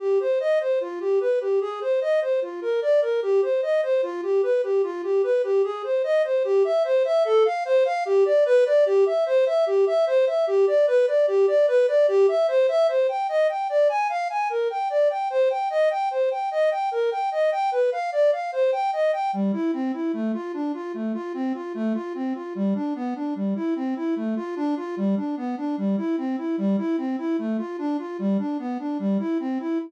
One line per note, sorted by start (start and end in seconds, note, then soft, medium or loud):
0.00 0.19 G4 medium
0.20 0.39 C5 medium
0.40 0.59 D#5 medium
0.60 0.79 C5 medium
0.81 0.99 F4 medium
1.00 1.19 G4 medium
1.21 1.39 B4 medium
1.41 1.59 G4 medium
1.61 1.80 G#4 medium
1.81 2.00 C5 medium
2.01 2.20 D#5 medium
2.21 2.40 C5 medium
2.42 2.60 F4 medium
2.62 2.80 A#4 medium
2.82 3.00 D5 medium
3.02 3.20 A#4 medium
3.22 3.41 G4 medium
3.42 3.61 C5 medium
3.62 3.81 D#5 medium
3.83 4.01 C5 medium
4.03 4.21 F4 medium
4.23 4.41 G4 medium
4.43 4.61 B4 medium
4.63 4.82 G4 medium
4.83 5.02 F4 medium
5.03 5.22 G4 medium
5.23 5.42 B4 medium
5.44 5.62 G4 medium
5.64 5.82 G#4 medium
5.84 6.02 C5 medium
6.04 6.22 D#5 medium
6.24 6.43 C5 medium
6.44 6.63 G4 medium
6.64 6.83 E5 medium
6.84 7.03 C5 medium
7.05 7.23 E5 medium
7.25 7.43 A4 loud
7.45 7.64 F5 medium
7.65 7.84 C5 loud
7.85 8.04 F5 medium
8.05 8.24 G4 loud
8.25 8.44 D5 medium
8.46 8.64 B4 loud
8.66 8.84 D5 medium
8.86 9.04 G4 loud
9.06 9.24 E5 medium
9.26 9.45 C5 loud
9.46 9.65 E5 medium
9.66 9.85 G4 medium
9.87 10.05 E5 medium
10.07 10.25 C5 loud
10.27 10.45 E5 medium
10.47 10.66 G4 medium
10.67 10.86 D5 medium
10.87 11.06 B4 loud
11.07 11.26 D5 medium
11.27 11.46 G4 medium
11.48 11.66 D5 medium
11.68 11.86 B4 loud
11.88 12.06 D5 medium
12.08 12.26 G4 loud
12.28 12.47 E5 medium
12.48 12.67 C5 loud
12.68 12.87 E5 loud
12.88 13.07 C5 medium
13.09 13.27 G5 medium
13.29 13.47 D#5 medium
13.49 13.68 G5 medium
13.69 13.88 D5 medium
13.89 14.08 G#5 medium
14.09 14.28 F5 medium
14.30 14.48 G#5 medium
14.50 14.68 A#4 medium
14.70 14.89 G5 medium
14.90 15.08 D5 medium
15.10 15.29 G5 medium
15.30 15.49 C5 medium
15.50 15.69 G5 medium
15.70 15.89 D#5 medium
15.90 16.09 G5 medium
16.11 16.29 C5 medium
16.31 16.49 G5 medium
16.51 16.70 D#5 medium
16.71 16.90 G5 medium
16.91 17.10 A#4 medium
17.11 17.30 G5 medium
17.32 17.50 D#5 medium
17.52 17.70 G5 medium
17.72 17.90 B4 medium
17.92 18.10 F5 medium
18.12 18.31 D5 medium
18.32 18.51 F5 medium
18.52 18.71 C5 medium
18.72 18.91 G5 medium
18.93 19.11 D#5 medium
19.13 19.31 G5 medium
19.33 19.52 G3 medium
19.53 19.71 E4 medium
19.73 19.92 C4 medium
19.93 20.12 E4 medium
20.13 20.32 A3 medium
20.34 20.52 F4 medium
20.54 20.72 D4 medium
20.74 20.92 F4 medium
20.94 21.13 A3 medium
21.14 21.33 F4 medium
21.34 21.53 C4 medium
21.54 21.73 F4 medium
21.74 21.93 A3 loud
21.94 22.13 F4 medium
22.15 22.33 C4 medium
22.35 22.53 F4 medium
22.55 22.74 G3 medium
22.75 22.94 D4 medium
22.95 23.14 B3 medium
23.15 23.34 D4 medium
23.35 23.54 G3 medium
23.56 23.74 E4 medium
23.76 23.94 C4 medium
23.96 24.15 E4 medium
24.16 24.35 A3 medium
24.36 24.55 F4 medium
24.56 24.75 D4 loud
24.77 24.95 F4 medium
24.97 25.15 G3 medium
25.17 25.35 D4 medium
25.37 25.56 B3 medium
25.57 25.76 D4 medium
25.77 25.96 G3 medium
25.97 26.16 E4 medium
26.18 26.36 C4 medium
26.38 26.56 E4 medium
26.58 26.76 G3 medium
26.78 26.96 E4 medium
26.98 27.16 C4 medium
27.18 27.37 E4 medium
27.39 27.57 A3 medium
27.58 27.77 F4 medium
27.78 27.97 D4 medium
27.99 28.17 F4 medium
28.19 28.37 G3 medium
28.39 28.57 D4 medium
28.59 28.78 B3 medium
28.79 28.98 D4 medium
28.99 29.18 G3 medium
29.19 29.38 E4 medium
29.40 29.58 C4 medium
29.60 29.78 E4 medium